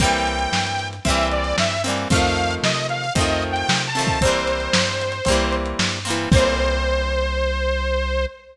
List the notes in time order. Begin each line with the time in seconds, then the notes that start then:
0.00 C2 G3 A#3 C4 G5, kick, closed hi-hat
0.04 E3
0.13 closed hi-hat
0.27 closed hi-hat
0.39 closed hi-hat
0.52 G2, snare
0.67 closed hi-hat
0.79 closed hi-hat
0.93 closed hi-hat
1.05 C2 G3 A#3 C4 E5, kick, closed hi-hat
1.10 E3
1.17 closed hi-hat
1.31 D5, closed hi-hat
1.44 closed hi-hat
1.58 G2 E5, snare
1.71 closed hi-hat
1.84 G3 A#3 C4, closed hi-hat
1.89 E3
1.98 closed hi-hat
2.10 F2 F3 A3 C4 F5, kick, closed hi-hat
2.15 D#3
2.24 closed hi-hat
2.37 closed hi-hat
2.51 closed hi-hat
2.63 C3 D#5, snare
2.75 closed hi-hat
2.89 F5, closed hi-hat
3.04 closed hi-hat
3.15 F2 F3 A3 C4 D#5, kick, closed hi-hat
3.21 D#3
3.28 closed hi-hat
3.42 closed hi-hat
3.51 G5
3.56 closed hi-hat
3.68 C3, snare
3.81 closed hi-hat
3.87 A5
3.95 F3 A3 C4, closed hi-hat
4.00 D#3
4.07 kick, closed hi-hat
4.21 C2 A#3 C4 C5, kick, closed hi-hat
4.25 E3 G3
4.33 closed hi-hat
4.47 closed hi-hat
4.60 closed hi-hat
4.73 G2, snare
4.87 closed hi-hat
5.01 closed hi-hat
5.12 closed hi-hat
5.25 C2 A#3 C4, kick, closed hi-hat
5.30 E3 G3
5.40 closed hi-hat
5.52 closed hi-hat
5.66 closed hi-hat
5.79 G2, snare
5.92 closed hi-hat
6.05 G3 A#3 C4, closed hi-hat
6.10 E3
6.18 closed hi-hat
6.31 C2 A#3 C4 C5, kick, crash
6.36 E3 G3